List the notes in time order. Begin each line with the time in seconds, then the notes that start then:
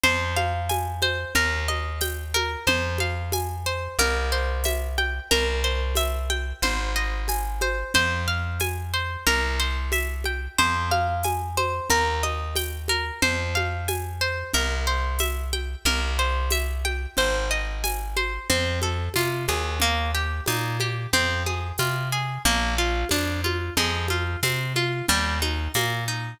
0.04 F2 C5, low conga
0.37 F5, high conga
0.69 G#5, tambourine, high conga
1.02 C5, high conga
1.35 D#2 A#4, low conga
1.68 D#5, high conga
2.01 G5, tambourine, high conga
2.34 A#4, high conga
2.67 F2 C5, low conga
2.98 F5, high conga
3.32 G#5, tambourine, high conga
3.66 C5
3.99 C2 A#4, low conga
4.32 C5
4.64 E5, tambourine, high conga
4.98 G5, high conga
5.31 C2 A#4, low conga
5.64 C5
5.95 E5, tambourine, high conga
6.30 G5, high conga
6.62 G#1 C5, low conga
6.96 D#5
7.28 G#5, tambourine, high conga
7.61 C5, high conga
7.94 F2 C5, low conga
8.28 F5
8.60 G#5, tambourine, high conga
8.94 C5
9.27 C2 A#4, low conga
9.60 C5
9.92 E5, tambourine, high conga
10.24 G5, high conga
10.59 F2 C5, low conga
10.91 F5, high conga
11.23 G#5, tambourine, high conga
11.57 C5, high conga
11.90 D#2 A#4, low conga
12.23 D#5, high conga
12.56 G5, tambourine, high conga
12.88 A#4, high conga
13.22 F2 C5, low conga
13.55 F5, high conga
13.88 G#5, tambourine, high conga
14.21 C5
14.54 C2 A#4, low conga
14.87 C5
15.19 E5, tambourine, high conga
15.53 G5, high conga
15.85 C2 A#4, low conga
16.19 C5
16.50 E5, tambourine, high conga
16.85 G5, high conga
17.17 G#1 C5, low conga
17.51 D#5
17.84 G#5, tambourine, high conga
18.17 C5, high conga
18.50 F2 C4, low conga
18.82 A4, high conga
19.14 C3 F4, tambourine, high conga
19.48 D#2 G#4, high conga
19.80 A#3, low conga
20.15 G4
20.46 A#2 D#4, tambourine, high conga
20.80 G4, high conga
21.13 F2 C4, low conga
21.46 G#4, high conga
21.78 C3 F4, tambourine, high conga
22.12 G#4
22.45 A#1 A#3, low conga
22.78 F4
23.09 F2 D4, tambourine, high conga
23.44 F4, high conga
23.77 F2 G#3, low conga
24.08 F4, high conga
24.43 C3 C4, tambourine, high conga
24.76 F4, high conga
25.09 D#2 G3, low conga
25.42 D#4, high conga
25.74 A#2 A#3, tambourine, high conga
26.08 D#4